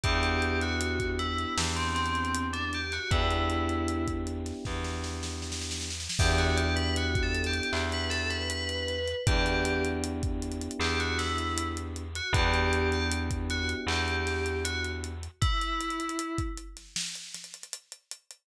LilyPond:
<<
  \new Staff \with { instrumentName = "Tubular Bells" } { \time 4/4 \key e \minor \tempo 4 = 78 g'8. fis'8. e'8 r16 c'16 c'8. d'16 g'16 fis'16 | e'4. r2 r8 | g'16 fis'16 g'16 b'16 \tuplet 3/2 { fis'8 a'8 g'8 } r16 b'16 a'16 b'16 b'4 | g'8. r4 r16 g'16 fis'16 e'8. r8 fis'16 |
g'8. g'16 r8 fis'16 r16 g'4 fis'16 r8. | e'4. r2 r8 | }
  \new Staff \with { instrumentName = "Electric Piano 1" } { \time 4/4 \key e \minor <b d' e' g'>1 | <b d' e' g'>1 | <b d' e' g'>1 | <b d' e' g'>1 |
<b d' e' g'>1 | r1 | }
  \new Staff \with { instrumentName = "Electric Bass (finger)" } { \clef bass \time 4/4 \key e \minor e,2 e,2 | e,2 e,2 | e,2 e,2 | e,2 e,2 |
e,2 e,2 | r1 | }
  \new DrumStaff \with { instrumentName = "Drums" } \drummode { \time 4/4 <hh bd>16 hh16 hh16 hh16 hh16 <hh bd>16 hh16 hh16 sn16 hh16 <hh sn>32 hh32 hh32 hh32 hh16 hh16 hh16 hh16 | <hh bd>16 hh16 hh16 hh16 hh16 <hh bd>16 hh16 <hh sn>16 <bd sn>16 sn16 sn16 sn16 sn32 sn32 sn32 sn32 sn32 sn32 sn32 sn32 | <cymc bd>16 hh16 hh16 hh16 hh16 <hh bd>16 hh32 hh32 hh32 hh32 hc16 <hh sn>16 <hh sn>16 hh16 hh16 hh16 hh16 hh16 | <hh bd>16 hh16 hh16 hh16 hh16 <hh bd>16 hh32 hh32 hh32 hh32 hc16 hh16 <hh sn>16 hh16 hh16 hh16 hh16 hh16 |
<hh bd>16 hh16 hh16 hh16 hh16 <hh bd>16 hh16 hh16 hc16 hh16 <hh sn>16 hh16 hh16 hh16 hh16 hh16 | <hh bd>16 hh16 hh32 hh32 hh32 hh32 hh16 <hh bd>16 hh16 <hh sn>16 sn16 hh16 <hh sn>32 hh32 hh32 hh32 hh16 hh16 hh16 hh16 | }
>>